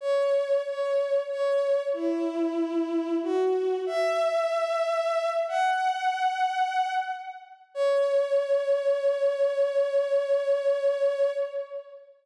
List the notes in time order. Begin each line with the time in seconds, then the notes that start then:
0.01 C#5
0.65 C#5
1.29 C#5
1.93 E4
3.23 F#4
3.86 E5
5.48 F#5
7.74 C#5